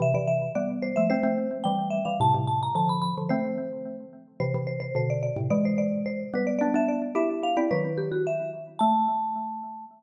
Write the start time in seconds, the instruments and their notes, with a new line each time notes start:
0.00 xylophone C3 E3, marimba E5
0.14 xylophone C3 E3, marimba D5
0.27 marimba E5
0.55 xylophone G3 B3, marimba D5
0.82 marimba C5
0.96 xylophone F3 A3, marimba E5
1.10 xylophone A3 C4, marimba C5
1.23 xylophone A3 C4
1.64 xylophone E3 G3, marimba G5
1.90 marimba E5
2.05 xylophone E3 G3, marimba F5
2.20 xylophone A2 C3, marimba A5
2.34 xylophone A2 C3
2.47 marimba A5
2.63 marimba A#5
2.75 xylophone D3 F3, marimba A5
2.89 marimba B5
3.02 marimba B5
3.18 xylophone D3 F3
3.29 xylophone A3 C4, marimba C5
4.40 xylophone C3 E3, marimba C5
4.54 xylophone C3 E3
4.67 marimba C5
4.80 marimba C5
4.95 xylophone B2 D3, marimba C5
5.10 marimba D5
5.23 marimba D5
5.36 xylophone A2 C3
5.50 xylophone E3 G#3, marimba D5
5.65 marimba C5
5.78 marimba D5
6.06 marimba C5
6.34 xylophone G3 B3, marimba B4
6.47 marimba D5
6.59 xylophone B3 D4, marimba D5
6.74 xylophone B3 D4, marimba E5
6.88 marimba D5
7.15 xylophone E4 G4, marimba E5
7.43 marimba F5
7.57 xylophone C4 E4, marimba D5
7.71 xylophone D#3 F#3, marimba B4
7.98 marimba G4
8.12 marimba F#4
8.27 marimba E5
8.79 xylophone A3, marimba A5